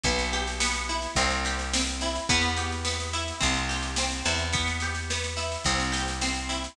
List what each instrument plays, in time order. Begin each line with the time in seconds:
0.04 electric bass (finger) B1, acoustic guitar (steel) B3, kick, snare
0.19 snare
0.33 acoustic guitar (steel) G4, snare
0.47 snare
0.60 acoustic guitar (steel) B3, snare
0.75 snare
0.89 acoustic guitar (steel) E4, snare
1.02 snare
1.15 electric bass (finger) C2, acoustic guitar (steel) C4, kick, snare
1.30 snare
1.45 acoustic guitar (steel) G4, snare
1.59 snare
1.73 acoustic guitar (steel) C4, snare
1.87 snare
2.01 acoustic guitar (steel) E4, snare
2.15 snare
2.29 electric bass (finger) E2, acoustic guitar (steel) B3, kick, snare
2.42 snare
2.56 acoustic guitar (steel) G4, snare
2.72 snare
2.85 acoustic guitar (steel) B3, snare
3.00 snare
3.13 acoustic guitar (steel) E4, snare
3.28 snare
3.40 electric bass (finger) C2, acoustic guitar (steel) C4, kick, snare
3.54 snare
3.69 acoustic guitar (steel) G4, snare
3.82 snare
3.96 acoustic guitar (steel) C4, snare
4.11 snare
4.25 electric bass (finger) E2, acoustic guitar (steel) E4, snare
4.39 snare
4.53 acoustic guitar (steel) B3, kick, snare
4.68 snare
4.80 acoustic guitar (steel) G4, snare
4.95 snare
5.10 acoustic guitar (steel) B3, snare
5.24 snare
5.37 acoustic guitar (steel) E4, snare
5.52 snare
5.64 electric bass (finger) C2, acoustic guitar (steel) C4, kick, snare
5.80 snare
5.92 acoustic guitar (steel) G4, snare
6.08 snare
6.21 acoustic guitar (steel) C4, snare
6.35 snare
6.49 acoustic guitar (steel) E4, snare
6.64 snare